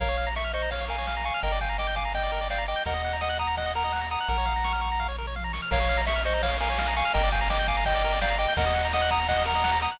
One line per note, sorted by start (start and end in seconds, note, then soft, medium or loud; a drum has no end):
0.00 1.31 A#1 medium
0.00 0.08 A#4 medium
0.00 0.29 C#5 medium
0.00 0.29 F5 medium
0.00 kick loud
0.00 crash loud
0.09 0.17 C#5 medium
0.17 0.26 F5 medium
0.17 ride medium
0.27 0.35 A#5 medium
0.36 0.51 E5 medium
0.36 0.44 C#6 medium
0.36 snare loud
0.44 0.52 F6 medium
0.53 0.70 C5 medium
0.53 0.70 D#5 medium
0.53 0.62 C#6 medium
0.53 ride medium
0.62 0.70 A#5 medium
0.71 0.85 C#5 medium
0.71 0.85 F5 medium
0.71 0.80 F5 medium
0.71 kick medium
0.71 ride loud
0.81 0.89 C#5 medium
0.88 0.96 A#4 medium
0.88 1.23 F5 medium
0.88 1.23 G#5 medium
0.88 ride medium
0.98 1.06 C#5 medium
1.07 1.15 F5 medium
1.07 snare loud
1.17 1.25 A#5 medium
1.24 1.40 F5 medium
1.24 1.40 G#5 medium
1.24 1.33 C#6 medium
1.24 ride medium
1.34 1.42 F6 medium
1.43 2.75 G1 medium
1.43 1.52 A#4 medium
1.43 1.59 D#5 medium
1.43 1.59 G5 medium
1.43 kick loud
1.43 ride loud
1.52 1.60 D5 medium
1.61 1.77 F5 medium
1.61 1.69 G5 medium
1.61 1.77 G#5 medium
1.61 kick medium
1.61 ride medium
1.69 1.77 A#5 medium
1.78 1.95 D#5 medium
1.78 1.95 G5 medium
1.78 1.87 D6 medium
1.78 snare loud
1.87 1.95 G6 medium
1.96 2.12 F5 medium
1.96 2.12 G#5 medium
1.96 2.04 D6 medium
1.96 kick medium
1.96 ride medium
2.05 2.13 A#5 medium
2.14 2.48 D#5 medium
2.14 2.48 G5 medium
2.14 2.23 G5 medium
2.14 kick medium
2.14 ride loud
2.23 2.31 D5 medium
2.32 2.40 A#4 medium
2.32 ride medium
2.41 2.49 D5 medium
2.50 2.65 D5 medium
2.50 2.65 F5 medium
2.50 2.59 G5 medium
2.50 snare loud
2.58 2.66 A#5 medium
2.67 2.83 D#5 medium
2.67 2.83 G5 medium
2.67 2.76 D6 soft
2.67 ride medium
2.76 2.84 G6 medium
2.85 4.17 D#2 medium
2.85 2.94 A#4 medium
2.85 3.17 D#5 medium
2.85 3.17 F#5 medium
2.85 kick loud
2.85 ride loud
2.94 3.02 D#5 medium
3.04 3.13 F#5 medium
3.04 ride medium
3.13 3.21 A#5 medium
3.21 3.38 D#5 medium
3.21 3.38 F#5 medium
3.21 3.29 D#6 medium
3.21 snare loud
3.29 3.37 F#6 medium
3.39 3.56 F#5 medium
3.39 3.56 A#5 medium
3.39 3.47 D#6 medium
3.39 kick medium
3.39 ride medium
3.47 3.55 A#5 medium
3.57 3.72 D#5 medium
3.57 3.72 F#5 medium
3.57 3.66 F#5 medium
3.57 kick medium
3.57 ride loud
3.66 3.74 D#5 medium
3.75 3.83 A#4 medium
3.75 4.07 F#5 medium
3.75 4.07 A#5 medium
3.75 ride medium
3.84 3.92 D#5 medium
3.92 4.01 F#5 medium
3.92 snare loud
4.01 4.09 A#5 medium
4.11 4.28 F#5 medium
4.11 4.28 A#5 medium
4.11 4.19 D#6 medium
4.11 ride medium
4.21 4.29 F#6 medium
4.28 5.60 A#1 medium
4.28 4.37 A#4 medium
4.28 5.07 F#5 medium
4.28 5.07 A#5 medium
4.28 kick medium
4.28 ride medium
4.38 4.46 C#5 medium
4.45 4.53 F5 medium
4.45 kick medium
4.45 ride medium
4.56 4.64 A#5 medium
4.64 4.72 C#6 medium
4.64 snare loud
4.73 4.81 F6 medium
4.81 4.89 C#6 medium
4.81 kick medium
4.81 ride medium
4.92 5.00 A#5 medium
5.00 5.08 F5 medium
5.00 kick medium
5.00 floor tom medium
5.08 5.17 C#5 medium
5.18 5.26 A#4 medium
5.18 mid tom medium
5.27 5.35 C#5 medium
5.36 5.44 F5 medium
5.36 high tom medium
5.44 5.52 A#5 medium
5.53 5.61 C#6 medium
5.53 snare loud
5.62 5.70 F6 medium
5.71 7.03 A#1 medium
5.71 5.79 A#4 loud
5.71 6.01 C#5 medium
5.71 6.01 F5 loud
5.71 kick loud
5.71 crash loud
5.80 5.88 C#5 medium
5.89 5.97 F5 loud
5.89 ride medium
5.97 6.05 A#5 medium
6.06 6.22 E5 loud
6.06 6.15 C#6 medium
6.06 snare loud
6.16 6.24 F6 medium
6.25 6.42 C5 medium
6.25 6.42 D#5 medium
6.25 6.33 C#6 medium
6.25 ride medium
6.34 6.42 A#5 medium
6.43 6.57 C#5 medium
6.43 6.51 F5 medium
6.43 6.57 F5 medium
6.43 kick loud
6.43 ride loud
6.51 6.59 C#5 medium
6.60 6.69 A#4 medium
6.60 6.94 F5 medium
6.60 6.94 G#5 medium
6.60 ride loud
6.70 6.78 C#5 medium
6.78 6.87 F5 medium
6.78 snare loud
6.88 6.96 A#5 medium
6.96 7.13 F5 medium
6.96 7.13 G#5 loud
6.96 7.04 C#6 medium
6.96 ride medium
7.05 7.13 F6 medium
7.14 8.47 G1 loud
7.14 7.22 A#4 loud
7.14 7.29 D#5 medium
7.14 7.29 G5 loud
7.14 kick loud
7.14 ride loud
7.23 7.31 D5 medium
7.32 7.48 F5 medium
7.32 7.40 G5 medium
7.32 7.48 G#5 medium
7.32 kick loud
7.32 ride medium
7.41 7.49 A#5 medium
7.50 7.67 D#5 medium
7.50 7.67 G5 medium
7.50 7.58 D6 medium
7.50 snare loud
7.59 7.67 G6 medium
7.68 7.84 F5 medium
7.68 7.84 G#5 medium
7.68 7.76 D6 medium
7.68 kick loud
7.68 ride medium
7.77 7.85 A#5 medium
7.85 8.19 D#5 medium
7.85 7.94 G5 medium
7.85 8.19 G5 loud
7.85 kick loud
7.85 ride loud
7.95 8.03 D5 medium
8.04 8.13 A#4 medium
8.04 ride medium
8.12 8.20 D5 medium
8.21 8.36 D5 medium
8.21 8.36 F5 loud
8.21 8.29 G5 medium
8.21 snare loud
8.30 8.38 A#5 medium
8.38 8.54 D#5 medium
8.38 8.54 G5 loud
8.38 8.46 D6 medium
8.38 ride medium
8.48 8.56 G6 medium
8.57 9.88 D#2 medium
8.57 8.65 A#4 loud
8.57 8.87 D#5 medium
8.57 8.87 F#5 loud
8.57 kick loud
8.57 ride loud
8.66 8.74 D#5 medium
8.74 8.83 F#5 medium
8.74 ride medium
8.85 8.93 A#5 medium
8.93 9.11 D#5 medium
8.93 9.10 F#5 loud
8.93 9.01 D#6 medium
8.93 snare loud
9.02 9.10 F#6 medium
9.10 9.28 F#5 medium
9.10 9.28 A#5 medium
9.10 9.19 D#6 medium
9.10 kick loud
9.10 ride medium
9.20 9.28 A#5 medium
9.28 9.43 D#5 medium
9.28 9.43 F#5 loud
9.28 9.37 F#5 medium
9.28 kick loud
9.28 ride loud
9.38 9.46 D#5 medium
9.45 9.53 A#4 medium
9.45 9.78 F#5 medium
9.45 9.78 A#5 loud
9.45 ride medium
9.55 9.63 D#5 medium
9.64 9.72 F#5 loud
9.64 snare loud
9.72 9.80 A#5 medium
9.82 9.99 F#5 medium
9.82 9.99 A#5 medium
9.82 9.90 D#6 medium
9.82 ride medium
9.92 9.99 F#6 medium